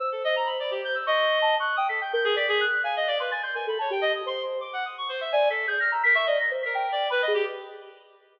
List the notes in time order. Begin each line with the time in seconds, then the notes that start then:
0.00 C5 E6
0.12 A4
0.24 D#5
0.36 A#5
0.46 B5
0.60 D5
0.71 G4
0.84 G6
0.95 E6
1.07 D#5 C#6
1.42 A5
1.60 C#6 F#6
1.76 G5 D#6
1.89 A4 B6
2.01 G5 G6
2.13 A#4 G6
2.24 G#4
2.36 D5 B6
2.48 G#4
2.61 F#6
2.84 F5 G#5
2.96 D#5
3.07 D5
3.20 B4 C6
3.31 G#5 A6
3.43 C6 G6
3.55 A#4 G#5
3.67 A4 B5
3.79 C#5 A5
3.90 G4 G5
4.01 D#5
4.15 D#6
4.26 C5 C6
4.61 D6
4.73 F#5
4.85 D#6
4.98 C#6
5.09 C5
5.21 E5
5.32 D5 G#5
5.50 A4 B6
5.67 G#4 G6
5.80 F6 A#6
5.92 A#5 E6
6.03 A#4 B6
6.15 E5 C#6
6.26 D5 D#5
6.39 A#6
6.51 C5
6.63 A#4 B6
6.75 G5
6.92 D5
7.10 B4 B5
7.22 D#5
7.28 G#4
7.34 G4